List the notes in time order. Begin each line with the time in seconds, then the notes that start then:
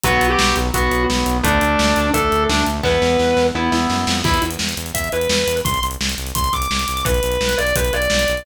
0.04 B1 F#3 B3 F#4, kick, closed hi-hat
0.21 B1, closed hi-hat
0.30 G4
0.39 B1, snare
0.56 B1, closed hi-hat
0.74 B1 F#3 B3 F#4, kick, closed hi-hat
0.91 B1, closed hi-hat
1.09 B1, snare
1.26 B1, closed hi-hat
1.43 D2 A3 D4, kick, closed hi-hat
1.61 D2, closed hi-hat
1.79 D2, snare
1.96 D2, closed hi-hat
2.13 D2 A3 D4 A4, kick, closed hi-hat
2.32 D2, closed hi-hat
2.49 D2 D4, snare
2.66 D2, closed hi-hat
2.83 E2 B3 E4 B4, kick, snare
3.02 E2, snare
3.19 E2, snare
3.37 E2, snare
3.55 E2 B3 E4
3.72 E2, snare
3.90 F#2, snare
4.07 F2, snare
4.24 E2 E4, kick, crash
4.34 closed hi-hat
4.42 E2, closed hi-hat
4.51 closed hi-hat
4.59 E2, snare
4.69 closed hi-hat
4.77 E2, closed hi-hat
4.86 closed hi-hat
4.94 E2 E5, kick, closed hi-hat
5.04 closed hi-hat
5.12 E2 B4, closed hi-hat
5.21 closed hi-hat
5.29 E2, snare
5.47 E2, closed hi-hat
5.57 closed hi-hat
5.65 C2 C6, kick, closed hi-hat
5.74 closed hi-hat
5.82 C2, closed hi-hat
5.91 closed hi-hat
6.00 C2, snare
6.09 closed hi-hat
6.18 C2, closed hi-hat
6.27 closed hi-hat
6.35 C2 C6, kick, closed hi-hat
6.44 closed hi-hat
6.53 C2 D6, kick, closed hi-hat
6.62 closed hi-hat
6.70 C2, snare
6.79 closed hi-hat
6.88 C2, closed hi-hat
6.97 closed hi-hat
7.05 B1 B4, kick, closed hi-hat
7.14 closed hi-hat
7.23 B1, closed hi-hat
7.32 closed hi-hat
7.40 B1, snare
7.49 closed hi-hat
7.58 B1 D5, closed hi-hat
7.67 closed hi-hat
7.76 B1 B4, kick, closed hi-hat
7.85 closed hi-hat
7.93 B1 D5, closed hi-hat
8.02 closed hi-hat
8.10 B1, snare
8.19 closed hi-hat
8.28 B1, closed hi-hat
8.37 closed hi-hat